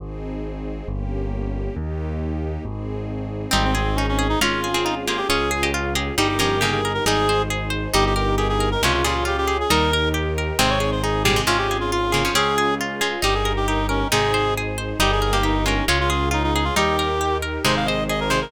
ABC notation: X:1
M:2/4
L:1/16
Q:1/4=136
K:Ab
V:1 name="Clarinet"
z8 | z8 | z8 | z8 |
C C C2 D D2 E | F4 E z F G | A4 z4 | G G G2 A A2 B |
A4 z4 | G G G2 A A2 B | F F F2 G G2 A | B4 z4 |
c d2 c A2 G2 | F G2 F F2 F2 | A4 z4 | G A2 G E2 D2 |
A4 z4 | G A2 G E2 D2 | F F F2 E E E F | G6 z2 |
c f e2 e B c B |]
V:2 name="Pizzicato Strings"
z8 | z8 | z8 | z8 |
[G,E]6 z2 | [A,F]3 [CA]3 [B,G]2 | [Fd]3 [Ge]3 [Ge]2 | [G,E]2 [F,D]2 [D,B,]2 z2 |
[G,E]8 | [G,E]2 z6 | [C,A,]2 [B,,G,]6 | [G,E]2 z6 |
[C,A,]6 [B,,G,] [C,A,] | [C,A,]6 [D,B,] [F,D] | [CA]6 [A,F]2 | [G,E]6 z2 |
[C,A,]6 z2 | [G,E]3 [B,G]3 [A,F]2 | [A,F]6 z2 | [G,E]4 z4 |
[C,A,]6 [C,A,]2 |]
V:3 name="Orchestral Harp"
z8 | z8 | z8 | z8 |
C2 A2 E2 A2 | D2 A2 F2 A2 | D2 A2 F2 A2 | E2 B2 G2 B2 |
E2 c2 A2 c2 | E2 B2 G2 B2 | D2 A2 F2 A2 | E2 B2 G2 B2 |
C2 A2 E2 A2 | D2 A2 F2 A2 | D2 A2 F2 A2 | E2 B2 G2 B2 |
E2 c2 A2 c2 | E2 B2 G2 B2 | D2 A2 F2 A2 | E2 B2 G2 B2 |
E2 c2 A2 c2 |]
V:4 name="Acoustic Grand Piano" clef=bass
A,,,8 | G,,,8 | E,,8 | A,,,8 |
A,,,8 | A,,,8 | D,,8 | G,,,8 |
A,,,8 | G,,,8 | D,,8 | E,,8 |
A,,,8 | A,,,8 | D,,8 | G,,,8 |
A,,,8 | G,,,8 | D,,8 | E,,8 |
A,,,8 |]
V:5 name="String Ensemble 1"
[CEA]8 | [B,DG]8 | [B,EG]8 | [CEA]8 |
[CEA]8 | [DFA]8 | [DFA]8 | [EGB]8 |
[EAc]8 | [EGB]8 | [DFA]8 | [EGB]8 |
[CEA]8 | [DFA]8 | [DFA]8 | [EGB]8 |
[EAc]8 | [EGB]8 | [DFA]8 | [EGB]8 |
[EAc]8 |]